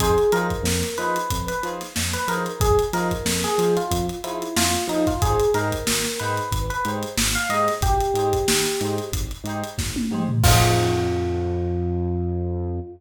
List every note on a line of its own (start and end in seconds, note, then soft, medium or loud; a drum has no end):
0.00 0.17 F2 loud
0.00 0.11 D#4 medium
0.00 0.11 F4 medium
0.00 0.31 G#4 medium
0.00 0.11 G#4 medium
0.00 0.11 C5 loud
0.00 kick medium
0.00 closed hi-hat medium
0.18 closed hi-hat medium
0.32 0.52 F3 medium
0.32 0.57 D#4 medium
0.32 0.57 F4 medium
0.32 0.57 G#4 medium
0.32 0.89 A#4 medium
0.32 closed hi-hat medium
0.37 0.57 C5 medium
0.50 kick medium
0.50 closed hi-hat medium
0.63 0.83 F2 medium
0.63 snare medium
0.83 snare soft
0.83 closed hi-hat medium
0.98 1.18 F3 loud
0.98 1.21 D#4 medium
0.98 1.21 F4 medium
0.98 1.21 G#4 medium
0.98 1.45 B4 medium
0.98 1.21 C5 medium
0.98 closed hi-hat medium
1.16 closed hi-hat medium
1.30 1.51 F2 medium
1.30 kick medium
1.30 closed hi-hat medium
1.48 1.62 B4 medium
1.48 closed hi-hat medium
1.63 1.82 F3 medium
1.63 1.87 D#4 medium
1.63 1.87 F4 medium
1.63 1.87 G#4 medium
1.63 closed hi-hat medium
1.67 1.87 C5 medium
1.81 snare soft
1.81 closed hi-hat medium
1.96 2.16 F2 medium
1.96 snare medium
2.13 2.27 B4 medium
2.13 closed hi-hat medium
2.28 2.47 F3 medium
2.28 2.52 D#4 medium
2.28 2.52 F4 medium
2.28 2.52 G#4 medium
2.28 2.45 A#4 medium
2.28 closed hi-hat medium
2.32 2.52 C5 medium
2.46 closed hi-hat medium
2.60 2.79 F2 medium
2.60 2.78 G#4 medium
2.60 kick loud
2.60 closed hi-hat medium
2.79 closed hi-hat medium
2.93 3.12 F3 medium
2.93 3.17 D#4 medium
2.93 3.17 F4 medium
2.93 3.17 G#4 medium
2.93 3.35 A#4 medium
2.93 snare soft
2.93 closed hi-hat medium
2.97 3.17 C5 medium
3.11 kick medium
3.11 closed hi-hat medium
3.25 3.45 F2 medium
3.25 snare medium
3.44 3.74 G#4 medium
3.44 snare soft
3.44 closed hi-hat medium
3.58 3.77 F3 medium
3.58 3.83 D#4 medium
3.58 3.83 F4 medium
3.58 3.83 G#4 medium
3.58 closed hi-hat medium
3.63 3.83 C5 medium
3.77 4.06 F4 medium
3.77 closed hi-hat medium
3.91 4.10 F2 medium
3.91 kick medium
3.91 closed hi-hat medium
4.09 closed hi-hat medium
4.24 4.43 F3 medium
4.24 4.48 D#4 medium
4.24 4.54 E4 medium
4.24 4.48 F4 medium
4.24 4.48 G#4 medium
4.24 4.48 C5 medium
4.24 closed hi-hat medium
4.42 closed hi-hat medium
4.57 4.76 F2 medium
4.57 4.85 F4 medium
4.57 snare medium
4.74 closed hi-hat medium
4.88 5.07 F3 medium
4.88 5.06 D#4 medium
4.88 5.02 D#4 medium
4.88 5.02 F4 medium
4.88 closed hi-hat medium
4.92 5.02 G#4 medium
4.92 5.02 C5 medium
5.07 5.21 F4 medium
5.07 kick medium
5.07 snare soft
5.07 closed hi-hat medium
5.22 5.42 G#1 medium
5.22 5.35 D#4 medium
5.22 5.35 G4 medium
5.22 5.50 G#4 medium
5.22 5.35 G#4 medium
5.22 5.35 C5 loud
5.22 kick medium
5.22 closed hi-hat medium
5.40 closed hi-hat medium
5.54 5.73 G#2 loud
5.54 5.78 D#4 medium
5.54 5.78 G4 medium
5.54 5.78 G#4 medium
5.54 6.12 A#4 medium
5.54 5.78 C5 medium
5.54 snare soft
5.54 closed hi-hat medium
5.72 kick medium
5.72 closed hi-hat medium
5.87 6.07 G#1 medium
5.87 snare medium
6.04 snare medium
6.04 closed hi-hat soft
6.19 6.40 G#2 medium
6.19 6.43 D#4 medium
6.19 6.43 G4 medium
6.19 6.43 G#4 medium
6.19 6.60 B4 medium
6.19 6.43 C5 medium
6.19 snare soft
6.19 closed hi-hat medium
6.37 closed hi-hat medium
6.51 6.71 G#1 medium
6.51 kick medium
6.51 closed hi-hat medium
6.70 6.84 B4 medium
6.70 closed hi-hat medium
6.85 7.04 G#2 medium
6.85 7.09 D#4 medium
6.85 7.09 G4 medium
6.85 7.09 G#4 medium
6.85 7.09 C5 medium
6.85 closed hi-hat medium
7.03 closed hi-hat medium
7.17 7.37 G#1 medium
7.17 snare medium
7.35 7.49 F5 medium
7.35 closed hi-hat medium
7.49 7.69 G#2 medium
7.49 7.74 D#4 medium
7.49 7.74 G4 medium
7.49 7.74 G#4 medium
7.49 7.67 D#5 medium
7.49 closed hi-hat medium
7.54 7.74 C5 medium
7.68 snare soft
7.68 closed hi-hat medium
7.81 8.00 G#1 medium
7.81 8.95 G4 medium
7.81 kick medium
7.81 closed hi-hat medium
8.01 closed hi-hat medium
8.14 8.33 G#2 medium
8.14 8.39 D#4 medium
8.14 8.39 G4 medium
8.14 8.39 G#4 medium
8.14 closed hi-hat medium
8.18 8.39 C5 medium
8.33 kick medium
8.33 closed hi-hat medium
8.47 8.67 G#1 medium
8.47 snare medium
8.65 snare soft
8.65 closed hi-hat medium
8.81 9.00 G#2 medium
8.81 9.05 D#4 medium
8.81 9.05 G4 medium
8.81 9.05 G#4 medium
8.81 9.05 C5 medium
8.81 closed hi-hat medium
8.98 closed hi-hat medium
9.12 9.32 G#1 medium
9.12 kick medium
9.12 closed hi-hat medium
9.31 closed hi-hat medium
9.44 9.63 G#2 medium
9.44 9.69 D#4 medium
9.44 9.69 G4 medium
9.44 closed hi-hat medium
9.48 9.69 G#4 medium
9.48 9.69 C5 medium
9.64 closed hi-hat medium
9.78 9.97 G#1 medium
9.78 kick medium
9.78 snare medium
9.96 high tom medium
10.11 10.30 G#2 medium
10.11 10.23 D#4 medium
10.11 10.23 G4 medium
10.11 10.23 G#4 medium
10.11 10.23 C5 medium
10.11 mid tom medium
10.29 floor tom medium
10.43 12.80 F2 loud
10.43 12.79 D#4 medium
10.43 12.79 F4 loud
10.43 12.79 G#4 loud
10.43 12.79 C5 loud
10.43 kick loud
10.43 crash loud